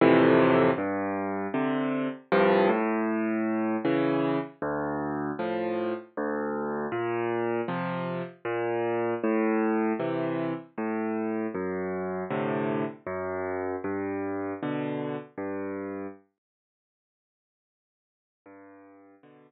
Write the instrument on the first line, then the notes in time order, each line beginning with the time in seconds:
acoustic grand piano
0.01 F2 A2 C3 E3
0.78 G2
1.54 C3 D3
2.32 C2 G2 F3
2.69 A2
3.85 C#3 E3
4.62 D2
5.39 A2 F3
6.17 D2
6.92 A#2
7.68 C3 F3
8.45 A#2
9.24 A2
10.00 C3 E3
10.78 A2
11.54 F#2
12.30 A2 C3 D3
13.07 F#2
13.84 G2
14.63 B2 D3
15.38 G2
18.46 G2
19.23 B2 D3